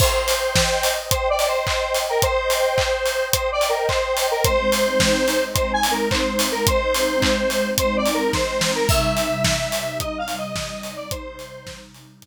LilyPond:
<<
  \new Staff \with { instrumentName = "Lead 1 (square)" } { \time 4/4 \key c \minor \tempo 4 = 108 c''2 \tuplet 3/2 { c''8 d''8 c''8 } c''8. bes'16 | c''2 \tuplet 3/2 { c''8 d''8 bes'8 } c''8. bes'16 | c''2 \tuplet 3/2 { c''8 aes''8 bes'8 } c''8. bes'16 | c''2 \tuplet 3/2 { c''8 d''8 bes'8 } c''8. bes'16 |
fes''2 \tuplet 3/2 { ees''8 f''8 ees''8 } ees''8. d''16 | c''4. r2 r8 | }
  \new Staff \with { instrumentName = "Pad 5 (bowed)" } { \time 4/4 \key c \minor <c'' ees'' g''>1~ | <c'' ees'' g''>1 | <aes c' ees'>1~ | <aes c' ees'>1 |
<c g ees'>1~ | <c g ees'>1 | }
  \new DrumStaff \with { instrumentName = "Drums" } \drummode { \time 4/4 <cymc bd>8 hho8 <bd sn>8 hho8 <hh bd>8 hho8 <hc bd>8 hho8 | <hh bd>8 hho8 <hc bd>8 hho8 <hh bd>8 hho8 <hc bd>8 hho8 | <hh bd>8 hho8 <bd sn>8 hho8 <hh bd>8 hho8 <hc bd>8 hho8 | <hh bd>8 hho8 <hc bd>8 hho8 <hh bd>8 hho8 <bd sn>8 sn8 |
<cymc bd>8 hho8 <bd sn>8 hho8 <hh bd>8 hho8 <bd sn>8 hho8 | <hh bd>8 hho8 <bd sn>8 hho8 <hh bd>4 r4 | }
>>